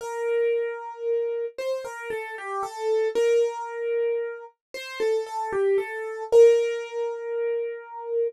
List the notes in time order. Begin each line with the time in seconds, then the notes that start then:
0.01 A#4
1.58 C5
1.85 A#4
2.10 A4
2.38 G4
2.63 A4
3.15 A#4
4.74 C5
5.00 A4
5.27 A4
5.52 G4
5.78 A4
6.32 A#4